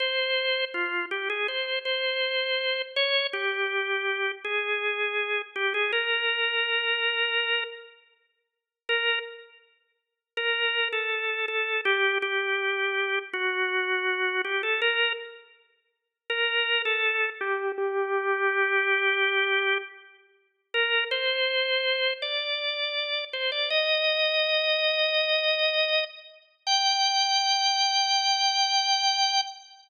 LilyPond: \new Staff { \time 4/4 \key f \minor \tempo 4 = 81 c''4 f'8 g'16 aes'16 c''8 c''4. | des''8 g'4. aes'4. g'16 aes'16 | bes'2~ bes'8 r4. | \key g \minor bes'8 r4. bes'8. a'8. a'8 |
g'8 g'4. fis'4. g'16 a'16 | bes'8 r4. bes'8. a'8. g'8 | g'2. r4 | bes'8 c''4. d''4. c''16 d''16 |
ees''2.~ ees''8 r8 | g''1 | }